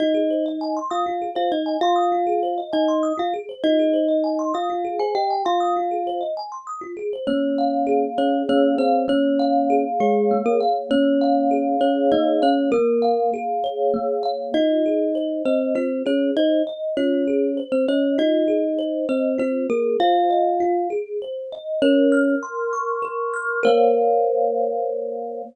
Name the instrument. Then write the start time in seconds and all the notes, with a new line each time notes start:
kalimba
0.00 D#4 F4 D#5
0.15 G#4
0.30 C5
0.46 D#5
0.61 G#5
0.77 C6
0.91 F4 F5 D#6
1.06 F4
1.22 G#4
1.35 F4 C5 F5
1.51 D#4 D#5
1.66 G#5
1.81 F4 F5 C6
1.96 D#6
2.12 F4
2.27 G#4
2.43 C5
2.58 D#5
2.73 D#4 D#5 G#5
2.88 C6
3.03 D#6
3.18 F4 F5
3.34 G#4
3.49 C5
3.64 D#4 F4 D#5
3.79 G#4
3.93 C5
4.08 D#5
4.24 G#5
4.39 C6
4.54 F4 F5 D#6
4.70 F4
4.85 G#4
4.99 G#4 C5 G#5
5.15 G4 D#5 G5
5.30 G#5
5.45 F4 F5 C6
5.60 D#6
5.77 F4
5.91 G#4
6.07 C5
6.21 D#5
6.37 G#5
6.52 C6
6.67 D#6
6.81 F4
6.97 G#4
7.13 C5
7.27 A#3 C#4 C#5
7.58 F5
7.87 G#4
8.18 C#4 C#5
8.49 A#3 C#4 C#5
8.78 C4 C5 F5
9.08 A#3 C#4 C#5
9.39 F5
9.70 G#4
10.00 G#3 G#4 C#5
10.31 A#3
10.46 A#3 A#4
10.60 F5
10.91 A#3 C#4 C#5
11.21 F5
11.51 G#4
11.81 C#4 C#5
12.12 A#3 D#4 D#5
12.42 C#4 C#5 F5
12.72 A#3 A#4
13.02 F5
13.34 G#4
13.64 C#5
13.94 A#3
14.23 F5
14.54 D#4 F4 D#5
14.86 G#4
15.15 C5
15.45 C4 C5 D#5
15.75 C4 F4 C5
16.06 C#4 G#4 C#5
16.37 D#4 C5 D#5
16.67 D#5
16.97 C#4 F4 C#5
17.28 G#4
17.57 C5
17.72 C4 C5
17.88 C#4 C#5 D#5
18.18 D#4 F4 D#5
18.48 G#4
18.79 C5
19.09 C4 C5 D#5
19.38 C4 F4 C5
19.70 A#3 G#4 A#4
20.00 F4 C5 F5
20.30 D#5
20.60 F4
20.90 G#4
21.22 C5
21.52 D#5
21.82 C#4 A#4 C#5
22.12 F6
22.43 C6
22.73 C#6
23.02 A#4
23.34 F6
23.63 A#3 A#4 C5 C#5 F5